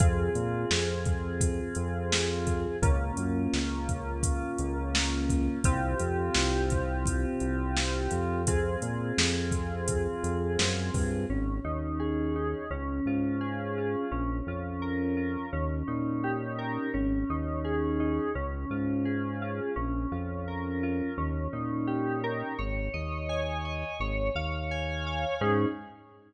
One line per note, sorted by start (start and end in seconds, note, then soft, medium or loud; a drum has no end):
0.00 0.30 F2 loud
0.00 2.76 C4 medium
0.00 2.76 F4 medium
0.00 2.76 G#4 medium
0.00 kick loud
0.00 closed hi-hat medium
0.35 0.65 A#2 medium
0.35 closed hi-hat medium
0.71 1.61 F2 medium
0.71 snare loud
1.05 kick medium
1.05 closed hi-hat medium
1.41 kick medium
1.41 closed hi-hat loud
1.75 2.66 F2 medium
1.75 closed hi-hat medium
2.12 snare loud
2.47 kick medium
2.47 closed hi-hat medium
2.82 3.12 C#2 loud
2.82 5.59 A#3 medium
2.82 5.59 C#4 medium
2.82 5.59 F4 medium
2.82 kick loud
2.82 closed hi-hat medium
3.17 3.47 F#2 medium
3.17 closed hi-hat medium
3.53 4.43 C#2 medium
3.53 snare medium
3.89 kick medium
3.89 closed hi-hat medium
4.23 kick medium
4.23 closed hi-hat loud
4.58 5.49 C#2 medium
4.58 closed hi-hat medium
4.95 snare loud
5.30 kick medium
5.30 closed hi-hat medium
5.64 5.95 C2 loud
5.64 8.42 C4 medium
5.64 8.42 F4 medium
5.64 8.42 G4 medium
5.64 kick loud
5.64 closed hi-hat loud
5.99 6.30 F2 medium
5.99 closed hi-hat medium
6.34 7.25 C2 medium
6.34 snare loud
6.70 kick medium
6.70 closed hi-hat medium
7.06 kick medium
7.06 closed hi-hat medium
7.40 8.08 C2 medium
7.40 closed hi-hat medium
7.77 snare loud
8.11 8.77 F2 medium
8.11 closed hi-hat medium
8.47 11.24 C4 medium
8.47 11.24 F4 medium
8.47 11.24 G#4 medium
8.47 kick medium
8.47 closed hi-hat loud
8.82 9.12 A#2 medium
8.82 closed hi-hat medium
9.18 10.08 F2 medium
9.18 snare loud
9.52 kick medium
9.52 closed hi-hat medium
9.88 kick medium
9.88 closed hi-hat loud
10.24 10.57 F2 medium
10.24 closed hi-hat medium
10.59 10.91 F#2 medium
10.59 snare loud
10.94 11.26 G2 medium
10.94 kick medium
10.94 open hi-hat medium
11.30 11.60 G#1 medium
11.30 12.64 C#4 medium
11.64 12.55 D#2 medium
11.64 12.35 D#4 medium
12.00 12.67 G#4 medium
12.36 12.69 D#4 medium
12.71 13.01 C#2 medium
12.71 14.05 C#4 medium
13.06 13.96 G#2 medium
13.06 13.77 F4 medium
13.41 14.08 G#4 medium
13.78 14.11 F4 medium
14.11 14.42 A#1 medium
14.11 15.46 C#4 medium
14.47 15.37 F2 medium
14.47 15.16 F4 medium
14.82 15.49 A#4 medium
15.17 15.50 F4 medium
15.53 15.83 D#2 medium
15.53 16.87 C#4 medium
15.87 16.78 A#2 medium
15.87 16.88 D#4 medium
16.24 16.91 G4 medium
16.59 16.92 A#4 medium
16.94 17.24 G#1 medium
16.94 18.28 C#4 medium
17.30 18.20 D#2 medium
17.30 17.99 D#4 medium
17.64 18.31 G#4 medium
18.00 18.33 D#4 medium
18.35 18.65 C#2 medium
18.35 19.69 C#4 medium
18.70 19.60 G#2 medium
18.70 19.41 F4 medium
19.05 19.72 G#4 medium
19.42 19.75 F4 medium
19.76 20.06 A#1 medium
19.76 21.10 C#4 medium
20.12 21.02 F2 medium
20.12 20.83 F4 medium
20.48 21.15 A#4 medium
20.83 21.17 F4 medium
21.18 21.48 D#2 medium
21.18 22.52 C#4 medium
21.53 22.43 A#2 medium
21.53 22.53 D#4 medium
21.87 22.54 G4 medium
22.24 22.57 A#4 medium
22.59 22.89 G#1 medium
22.59 23.93 C#5 medium
22.94 23.84 D#2 medium
22.94 23.64 D#5 medium
23.29 23.96 G#5 medium
23.65 23.99 D#5 medium
24.00 24.30 G#1 medium
24.00 25.35 C#5 medium
24.35 25.25 D#2 medium
24.35 25.06 F5 medium
24.71 25.38 G#5 medium
25.06 25.40 F5 medium
25.41 25.66 G#2 medium
25.41 25.66 C#4 loud
25.41 25.66 D#4 loud
25.41 25.66 G#4 medium